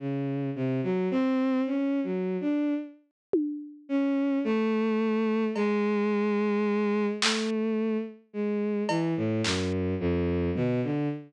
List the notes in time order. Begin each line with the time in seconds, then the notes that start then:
0.00 C#3
0.56 C3
0.83 F#3
1.11 C4
1.67 C#4
2.04 F#3
2.41 D4
3.33 high tom
3.89 C#4
4.44 A3
5.56 G#3, cowbell
7.22 A3, clap
8.33 G#3
8.89 E3, cowbell
9.17 A2
9.44 F#2, clap
10.00 F2
10.56 B2, floor tom
10.83 D3